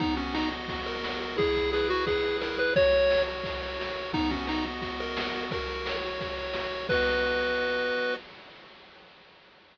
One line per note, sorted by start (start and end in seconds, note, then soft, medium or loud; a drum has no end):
0.00 0.51 B3 loud
0.00 0.15 D#4 medium
0.00 kick loud
0.00 crash loud
0.16 0.34 C#4 medium
0.16 0.69 F#4 medium
0.16 ride medium
0.34 0.49 D#4 medium
0.34 0.86 D#5 medium
0.34 snare loud
0.51 1.03 B3 medium
0.51 ride medium
0.68 1.20 F#4 loud
0.68 kick medium
0.68 ride loud
0.86 1.36 A#4 medium
0.86 1.36 D#5 medium
0.86 ride medium
1.03 1.36 B3 medium
1.03 snare loud
1.20 1.37 F#4 medium
1.20 ride medium
1.37 1.90 E4 loud
1.37 1.71 G#4 loud
1.37 kick loud
1.37 ride loud
1.55 2.08 G#4 medium
1.55 kick medium
1.55 ride medium
1.73 1.88 G#4 medium
1.73 2.22 B4 loud
1.73 snare medium
1.89 2.41 E4 medium
1.89 2.05 F#4 medium
1.89 ride medium
2.06 2.37 G#4 medium
2.06 2.57 G#4 loud
2.06 kick medium
2.06 ride loud
2.23 2.72 B4 medium
2.23 ride medium
2.41 2.74 E4 medium
2.41 2.58 A#4 medium
2.41 snare loud
2.58 2.74 G#4 loud
2.58 2.73 B4 medium
2.58 ride medium
2.76 3.27 F#4 loud
2.76 3.22 C#5 loud
2.76 kick loud
2.76 ride loud
2.93 3.44 A#4 medium
2.93 ride medium
3.10 3.62 C#5 medium
3.10 snare loud
3.27 3.79 F#4 medium
3.27 ride medium
3.44 3.96 A#4 medium
3.44 kick medium
3.44 ride loud
3.61 4.11 C#5 medium
3.61 ride medium
3.79 4.12 F#4 medium
3.79 snare loud
3.96 4.13 A#4 medium
3.96 ride medium
4.13 4.65 B3 loud
4.13 4.31 D#4 loud
4.13 kick loud
4.13 ride loud
4.30 4.45 C#4 medium
4.30 4.81 F#4 medium
4.30 kick medium
4.30 ride medium
4.47 4.65 D#4 medium
4.47 4.99 D#5 medium
4.47 snare loud
4.64 5.17 B3 medium
4.64 ride medium
4.82 5.34 F#4 loud
4.82 kick medium
4.82 ride loud
4.99 5.43 A#4 medium
4.99 5.48 D#5 medium
4.99 ride medium
5.17 5.50 B3 loud
5.17 snare loud
5.34 5.51 F#4 medium
5.34 ride medium
5.51 6.04 F#4 loud
5.51 5.96 A#4 medium
5.51 kick loud
5.51 ride loud
5.67 6.19 A#4 medium
5.67 ride medium
5.86 6.37 C#5 medium
5.86 snare loud
6.03 6.54 F#4 loud
6.03 ride medium
6.19 6.72 A#4 medium
6.19 kick medium
6.19 ride loud
6.38 6.87 C#5 medium
6.38 ride medium
6.54 6.87 F#4 loud
6.54 snare loud
6.72 6.89 A#4 medium
6.72 ride medium
6.89 8.16 B3 loud
6.89 8.16 F#4 loud
6.89 8.14 B4 loud
6.89 8.16 D#5 loud
6.89 kick loud
6.89 crash loud